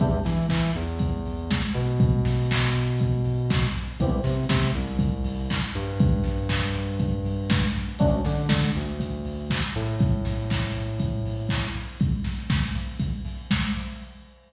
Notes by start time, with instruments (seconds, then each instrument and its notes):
0.00 synth bass 2 E2, electric piano 2 B3 D4 E4 G4, kick, closed hi-hat
0.24 synth bass 2 E3, electric piano 2 E4, snare, open hi-hat
0.49 synth bass 2 E3, electric piano 2 E4, kick, clap
0.75 synth bass 2 E2, electric piano 2 E3, open hi-hat
0.99 kick, closed hi-hat
1.25 open hi-hat
1.51 kick, snare
1.74 synth bass 2 B2, electric piano 2 B3, open hi-hat
2.00 kick, closed hi-hat
2.25 snare, open hi-hat
2.51 kick, clap
2.75 open hi-hat
2.99 kick, closed hi-hat
3.24 open hi-hat
3.50 kick, clap
3.76 open hi-hat
4.00 synth bass 2 C2, electric piano 2 B3 C4 E4 G4, kick, closed hi-hat
4.24 synth bass 2 C3, electric piano 2 C4, snare, open hi-hat
4.48 synth bass 2 C3, electric piano 2 C4, kick, snare
4.75 synth bass 2 C2, electric piano 2 C3, open hi-hat
4.99 kick, closed hi-hat
5.24 open hi-hat
5.50 kick, clap
5.74 synth bass 2 G2, electric piano 2 G3, open hi-hat
6.00 kick, closed hi-hat
6.24 snare, open hi-hat
6.49 kick, clap
6.76 open hi-hat
6.99 kick, closed hi-hat
7.25 open hi-hat
7.50 kick, snare
7.75 open hi-hat
7.99 synth bass 2 D2, electric piano 2 A3 C#4 D4 F#4, kick, closed hi-hat
8.24 synth bass 2 D3, electric piano 2 D4, snare, open hi-hat
8.49 synth bass 2 D3, electric piano 2 D4, kick, snare
8.74 synth bass 2 D2, electric piano 2 D3, open hi-hat
9.00 kick, closed hi-hat
9.25 open hi-hat
9.50 kick, clap
9.75 synth bass 2 A2, electric piano 2 A3, open hi-hat
9.99 kick, closed hi-hat
10.25 snare, open hi-hat
10.50 kick, clap
10.75 open hi-hat
11.00 kick, closed hi-hat
11.25 open hi-hat
11.49 kick, clap
11.75 open hi-hat
12.00 kick, closed hi-hat
12.24 snare, open hi-hat
12.50 kick, snare
12.74 open hi-hat
13.00 kick, closed hi-hat
13.25 open hi-hat
13.51 kick, snare
13.76 open hi-hat